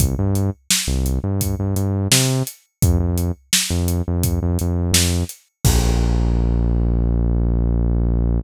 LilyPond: <<
  \new Staff \with { instrumentName = "Synth Bass 1" } { \clef bass \time 4/4 \key bes \major \tempo 4 = 85 c,16 g,4 c,8 g,8 g,16 g,8 c4 | f,16 f,4 f,8 f,8 f,16 f,8 f,4 | bes,,1 | }
  \new DrumStaff \with { instrumentName = "Drums" } \drummode { \time 4/4 <hh bd>8 hh8 sn8 hh8 <hh bd>8 hh8 sn8 hh8 | <hh bd>8 hh8 sn8 hh8 <hh bd>8 hh8 sn8 hh8 | <cymc bd>4 r4 r4 r4 | }
>>